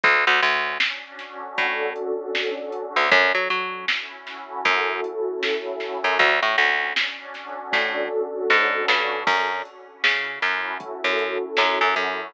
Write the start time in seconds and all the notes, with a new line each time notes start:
0.04 D2 C#4, kick, closed hi-hat
0.27 D2
0.42 D2 D4, closed hi-hat
0.80 F#4, snare
1.19 A4, snare, closed hi-hat
1.58 A2 C#4, kick, closed hi-hat
1.96 D4, closed hi-hat
2.35 F#4, snare
2.72 A4, closed hi-hat
2.96 D2
3.11 F#2 C#4, kick, closed hi-hat
3.35 F#3
3.50 F#3 E4, closed hi-hat
3.88 F#4, snare
4.27 A4, snare, closed hi-hat
4.65 F#2 C#4, kick, closed hi-hat
5.04 E4, closed hi-hat
5.43 F#4, snare
5.80 A4, snare
6.04 F#2
6.19 D2 C#4, kick, closed hi-hat
6.42 A2
6.58 D2 D4, closed hi-hat
6.96 F#4, snare
7.34 A4, snare, closed hi-hat
7.72 A2 C#4, kick, snare, closed hi-hat
8.12 D4
8.49 G#2 F#4, snare
8.88 G2 A4, snare
9.27 F#2 C#4, kick, crash
9.65 E4, closed hi-hat
10.04 C#3 F#4, snare
10.42 F#2 A4, snare, closed hi-hat
10.80 C#4, kick, closed hi-hat
11.04 F#2
11.19 E4, closed hi-hat
11.57 F#2 F#4, snare
11.81 F#2
11.96 F#2 A4, closed hi-hat